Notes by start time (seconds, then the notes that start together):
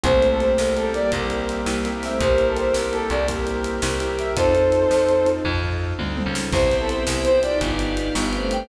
0.04 C2 G3 A3 A#3 C4 E4 G4 C5, kick, closed hi-hat
0.22 A#3 C4 E4 G4, closed hi-hat
0.31 A4
0.40 A#3 C4 E4 G4 C5, closed hi-hat
0.58 C2 G3 A#3 E4 G4, snare
0.76 A#3 C4 E4 G4 A4, closed hi-hat
0.94 G3 A#3 C4 E4 G4 D5, closed hi-hat
1.12 C2 G3 A#3 C4 E4 G4, kick, closed hi-hat
1.30 closed hi-hat
1.49 closed hi-hat
1.66 C2 G3 A#3 C4 E4 G4, snare
1.85 A#3 C4 E4 G4, closed hi-hat
2.02 A3 C4 E5, open hi-hat
2.19 C2 G3 A#3 C4 E4 G4 A#4 C5, kick, closed hi-hat
2.38 A#3 C4 E4 G4, closed hi-hat
2.48 A4
2.57 A#3 C4 E4 G4 C5, closed hi-hat
2.73 C2 G3 A#3 E4 G4, snare
2.92 A#3 C4 E4 G4 A4, closed hi-hat
3.10 C2 A#3 C4 E4 G4 D5, closed hi-hat
3.28 G3 A#3 C4 E4 G4 A#4, kick, closed hi-hat
3.47 closed hi-hat
3.64 closed hi-hat
3.82 C2 G3 A#3 C4 E4 G4, snare
4.00 A#3 C4 E4 G4, closed hi-hat
4.19 E5, closed hi-hat
4.36 F2 C4 D#4 F4 A4 C5, kick, closed hi-hat
4.55 C4 D#4 F4 A4, closed hi-hat
4.72 C4 D#4 F4 A4, closed hi-hat
4.91 F2, snare
5.09 closed hi-hat
5.26 C4 D#4 F4 A4, closed hi-hat
5.45 F2 C4 D#4 F4 A4, kick, floor tom
5.63 floor tom
5.99 D2 C4 D#4 F4 A4, high tom
6.17 C4 D#4 F4 A4, high tom
6.26 C#2
6.35 snare
6.52 C2 B3 C4 E4 G4 B4 C5 E5, kick, crash
6.70 B3 C4 E4 G4, closed hi-hat
6.80 A4
6.89 C5, closed hi-hat
7.07 C2 G4 B4 E5 G5, snare
7.24 C5, closed hi-hat
7.43 B3 D4 D#4 F4 G4 D5, closed hi-hat
7.60 G1 G4 B4 D5 F5, kick, closed hi-hat
7.79 B3 D4 F4 G4, closed hi-hat
7.97 closed hi-hat
8.15 G1 B3 D4 F4 G4 B4 F5 G5, snare
8.33 A3 C4, closed hi-hat
8.51 G5, closed hi-hat